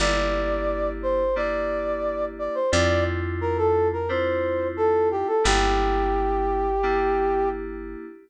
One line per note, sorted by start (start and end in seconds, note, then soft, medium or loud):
0.00 2.49 G1 medium
0.00 1.22 A#3 medium
0.00 1.22 D4 medium
0.00 1.22 E4 medium
0.00 1.22 G4 medium
0.00 0.90 D5 loud
1.03 1.36 C5 medium
1.36 2.58 A#3 medium
1.36 2.58 D4 medium
1.36 2.58 E4 medium
1.36 2.58 G4 medium
1.36 2.25 D5 loud
2.39 2.55 D5 medium
2.55 2.71 C5 medium
2.72 5.24 F2 loud
2.72 3.95 C4 medium
2.72 3.95 D4 medium
2.72 3.95 E4 medium
2.72 3.95 F4 medium
2.72 3.04 D5 loud
3.41 3.57 A#4 loud
3.58 3.88 A4 loud
3.93 4.09 A#4 medium
4.09 5.32 C4 medium
4.09 5.32 D4 medium
4.09 5.32 E4 medium
4.09 5.32 F4 medium
4.09 4.68 C5 medium
4.77 5.09 A4 loud
5.11 5.28 G4 medium
5.27 5.44 A4 medium
5.44 7.96 G1 loud
5.44 6.67 A#3 medium
5.44 6.67 D4 medium
5.44 6.67 E4 medium
5.44 6.67 G4 medium
5.44 7.49 G4 loud
6.83 8.06 A#3 medium
6.83 8.06 D4 medium
6.83 8.06 E4 medium
6.83 8.06 G4 medium